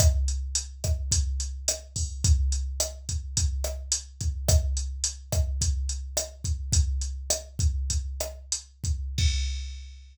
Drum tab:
CC |--------|--------|--------|--------|
HH |xxxxxxxo|xxxxxxxx|xxxxxxxx|xxxxxxxx|
SD |r--r--r-|--r--r--|r--r--r-|--r--r--|
BD |o--oo--o|o--oo--o|o--oo--o|o--oo--o|

CC |x-------|
HH |--------|
SD |--------|
BD |o-------|